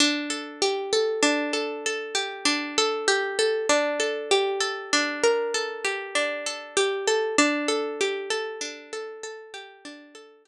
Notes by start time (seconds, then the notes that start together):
0.00 D4
0.30 A4
0.62 G4
0.93 A4
1.23 D4
1.53 A4
1.86 A4
2.15 G4
2.45 D4
2.78 A4
3.08 G4
3.39 A4
3.69 D4
4.00 A4
4.31 G4
4.61 A4
4.93 D4
5.23 A#4
5.54 A4
5.84 G4
6.15 D4
6.46 A4
6.77 G4
7.07 A4
7.38 D4
7.68 A4
8.01 G4
8.30 A4
8.61 D4
8.93 A4
9.23 A4
9.54 G4
9.85 D4
10.15 A4
10.45 G4